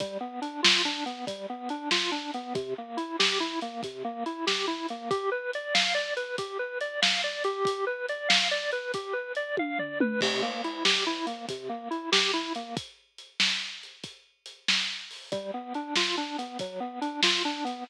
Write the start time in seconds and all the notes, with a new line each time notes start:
0.00 G3, kick, closed hi-hat
0.21 B3
0.42 D4, closed hi-hat
0.63 F4, snare
0.85 D4
1.06 B3, closed hi-hat
1.27 G3, kick, closed hi-hat
1.50 B3
1.69 D4, closed hi-hat
1.91 F4, snare
2.12 D4
2.34 B3, closed hi-hat
2.55 C3, kick, closed hi-hat
2.78 A#3
2.97 E4, closed hi-hat
3.19 G4, snare
3.40 E4
3.61 A#3, closed hi-hat
3.83 C3, kick, closed hi-hat
4.05 A#3
4.26 E4, closed hi-hat
4.47 G4, snare
4.67 E4
4.89 A#3, closed hi-hat
5.10 G4, kick, closed hi-hat
5.32 B4
5.53 D5, closed hi-hat
5.74 F5, snare
5.95 D5
6.17 B4, closed hi-hat
6.38 G4, kick, closed hi-hat
6.59 B4
6.81 D5, closed hi-hat
7.02 F5, snare
7.24 D5
7.44 G4, closed hi-hat
7.65 kick, closed hi-hat
7.87 B4
8.09 D5, closed hi-hat
8.29 F5, snare
8.51 D5
8.72 B4, closed hi-hat
8.94 G4, kick, closed hi-hat
9.13 B4
9.35 D5, closed hi-hat
9.57 F5, kick, high tom
9.79 D5, floor tom
10.00 B4, mid tom
10.21 C3, kick, crash
10.42 A#3
10.64 E4, closed hi-hat
10.85 G4, snare
11.06 E4
11.27 A#3, closed hi-hat
11.49 C3, kick, closed hi-hat
11.69 A#3
11.91 E4, closed hi-hat
12.12 G4, snare
12.34 E4
12.55 A#3, closed hi-hat
12.77 kick, closed hi-hat
13.18 closed hi-hat
13.40 snare
13.83 closed hi-hat
14.04 kick, closed hi-hat
14.46 closed hi-hat
14.68 snare
15.11 open hi-hat
15.32 G3, kick, closed hi-hat
15.54 B3
15.74 D4, closed hi-hat
15.96 F4, snare
16.17 D4
16.38 B3, closed hi-hat
16.59 F#3, kick, closed hi-hat
16.80 B3
17.01 D4, closed hi-hat
17.23 F4, snare
17.45 D4
17.65 B3, closed hi-hat